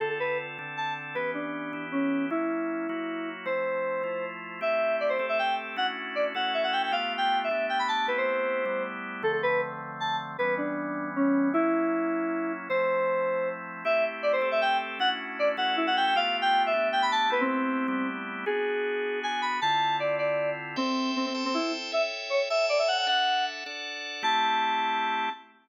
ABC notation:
X:1
M:3/4
L:1/16
Q:1/4=156
K:Ddor
V:1 name="Electric Piano 2"
A A B2 z4 a2 z2 | B2 D6 ^C4 | _F12 | c10 z2 |
[K:Ador] e4 d c2 e g2 z2 | f z3 d z f2 e f g g | (3=f4 g4 e4 g b a2 | B c7 z4 |
[K:Ddor] A A B2 z4 a2 z2 | B2 D6 ^C4 | _F12 | c10 z2 |
[K:Ador] e2 z2 d c2 e g2 z2 | f z3 d z f2 E f g g | (3=f4 g4 e4 g b a2 | B C7 z4 |
[K:Ddor] ^G8 ^g2 b2 | a4 d2 d4 z2 | [K:Ador] C4 C C2 C E2 z2 | e z3 ^c z e2 d e f f |
f4 z8 | a12 |]
V:2 name="Drawbar Organ"
[D,CFA]6 [D,CDA]6 | [E,B,^CG]6 [E,B,EG]6 | [_G,_B,_D_F]6 [G,B,F_G]6 | [F,A,CE]6 [F,A,EF]6 |
[K:Ador] [A,CEG]6 [A,CGA]6 | [A,^CDEF]6 [A,CEFA]6 | [A,B,=FG]6 [A,B,DG]6 | [A,B,CEG]6 [G,A,B,EG]6 |
[K:Ddor] [D,F,A,C]12 | [E,G,B,^C]12 | [_G,_B,_D_F]12 | [F,A,CE]12 |
[K:Ador] [A,CEG]6 [A,CGA]6 | [A,^CDEF]6 [A,CEFA]6 | [A,B,=FG]6 [A,B,DG]6 | [A,B,CEG]6 [G,A,B,EG]6 |
[K:Ddor] [B,D^F^G]12 | [D,CEF]12 | [K:Ador] [Aceg]6 [Acga]6 | [A^ceg]6 [Acga]6 |
[DAef]6 [DAdf]6 | [A,CEG]12 |]